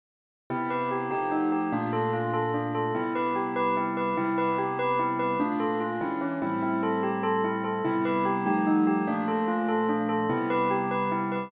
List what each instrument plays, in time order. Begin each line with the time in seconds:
0.50 acoustic grand piano C3 B3 E4 G4, tubular bells E4
0.70 tubular bells B4
0.91 tubular bells G4
1.11 acoustic grand piano F3 A3 D#4 G4, tubular bells G4
1.31 tubular bells D#4
1.52 tubular bells G4
1.72 acoustic grand piano A#2 A3 D4 F4, tubular bells D4
1.93 tubular bells A4
2.13 tubular bells F4
2.34 tubular bells A4
2.54 tubular bells D4
2.75 tubular bells A4
2.95 acoustic grand piano C3 G3 B3 E4, tubular bells E4
3.15 tubular bells B4
3.36 tubular bells G4
3.56 tubular bells B4
3.77 tubular bells E4
3.97 tubular bells B4
4.17 acoustic grand piano C3 G3 B3 E4, tubular bells E4
4.38 tubular bells B4
4.58 tubular bells G4
4.79 tubular bells B4
4.99 tubular bells E4
5.19 tubular bells B4
5.40 acoustic grand piano A#2 A3 D4 F4, tubular bells D4
5.60 tubular bells A4
5.80 tubular bells F4
6.01 acoustic grand piano E3 G#3 C#4 D4, tubular bells E4
6.21 tubular bells C#4
6.42 acoustic grand piano A2 G3 C4 E4, tubular bells E4
6.62 tubular bells E4
6.83 tubular bells A4
7.03 tubular bells G4
7.23 tubular bells A4
7.44 tubular bells E4
7.64 tubular bells A4
7.84 acoustic grand piano C3 G3 B3 E4, tubular bells E4
8.05 tubular bells B4
8.25 tubular bells G4
8.46 acoustic grand piano F3 G3 A3 D#4, tubular bells G4
8.67 tubular bells D#4
8.87 tubular bells G4
9.07 acoustic grand piano A#2 F3 A3 D4, tubular bells D4
9.28 tubular bells A4
9.48 tubular bells F4
9.68 tubular bells A4
9.89 tubular bells D4
10.09 tubular bells A4
10.29 acoustic grand piano C3 G3 B3 E4, tubular bells E4
10.50 tubular bells B4
10.71 tubular bells G4
10.91 tubular bells B4
11.12 tubular bells E4
11.32 tubular bells B4